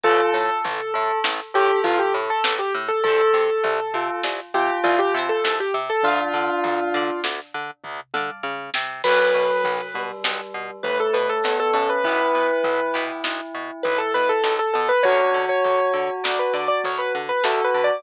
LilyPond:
<<
  \new Staff \with { instrumentName = "Acoustic Grand Piano" } { \time 5/4 \key a \minor \tempo 4 = 100 a'2 r8 g'8 f'16 g'16 r16 a'8 g'16 r16 a'16 | a'2 r8 g'8 f'16 g'16 r16 a'8 g'16 r16 a'16 | f'2 r2. | \key b \minor b'2 r4 b'16 a'16 b'16 a'8 a'16 a'16 b'16 |
b'2 r4 b'16 a'16 b'16 a'8 a'16 a'16 b'16 | cis''8. cis''4~ cis''16 d''16 b'16 d''16 d''16 cis''16 b'16 r16 b'16 \tuplet 3/2 { a'8 b'8 d''8 } | }
  \new Staff \with { instrumentName = "Tubular Bells" } { \time 5/4 \key a \minor f'8 r4 a'8 r8 a'4. r4 | a'8 r4 f'8 r8 f'4. r4 | d'2 r2. | \key b \minor fis4. g4. a4 b8 cis'8 |
e'1 r4 | fis'1 fis'4 | }
  \new Staff \with { instrumentName = "Orchestral Harp" } { \time 5/4 \key a \minor <d'' f'' a''>1~ <d'' f'' a''>4 | <c'' e'' a'' b''>2.~ <c'' e'' a'' b''>8 <c'' e'' a'' b''>4. | <d'' f'' a''>4. <d'' f'' a''>2 <d'' f'' a''>4. | \key b \minor <b cis' d' fis'>1~ <b cis' d' fis'>4 |
<b e' g'>4. <b e' g'>2.~ <b e' g'>8 | <b cis' d' fis'>1~ <b cis' d' fis'>4 | }
  \new Staff \with { instrumentName = "Electric Bass (finger)" } { \clef bass \time 5/4 \key a \minor a,,8 a,8 a,,8 a,8 a,,8 a,8 a,,8 a,8 a,,8 a,8 | c,8 c8 c,8 c8 c,8 c8 c,8 c8 c,8 c8 | d,8 d8 d,8 d8 d,8 d8 d,8 d8 des8 c8 | \key b \minor b,,8 b,8 b,,8 b,8 b,,8 b,8 b,,8 b,8 b,,8 b,8 |
b,,8 b,8 b,,8 b,8 b,,8 b,8 b,,8 b,8 b,,8 b,8 | d,8 d8 d,8 d8 d,8 d8 d,8 d8 d,8 d8 | }
  \new DrumStaff \with { instrumentName = "Drums" } \drummode { \time 5/4 <bd tomfh>4 tomfh4 sn4 tomfh4 sn4 | <bd tomfh>4 tomfh4 sn4 tomfh4 sn4 | <bd tomfh>4 tomfh4 sn4 <bd tomfh>8 toml8 r8 sn8 | <cymc bd>4 tomfh4 sn4 tomfh4 sn4 |
<bd tomfh>4 tomfh4 sn4 tomfh4 sn4 | <bd tomfh>4 tomfh4 sn4 tomfh4 sn4 | }
>>